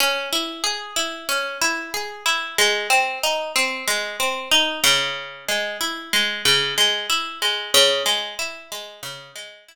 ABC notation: X:1
M:4/4
L:1/8
Q:1/4=93
K:C#dor
V:1 name="Acoustic Guitar (steel)"
C E G E C E G E | G, ^B, D B, G, B, D C,- | C, G, E G, C, G, E G, | C, G, E G, C, G, E z |]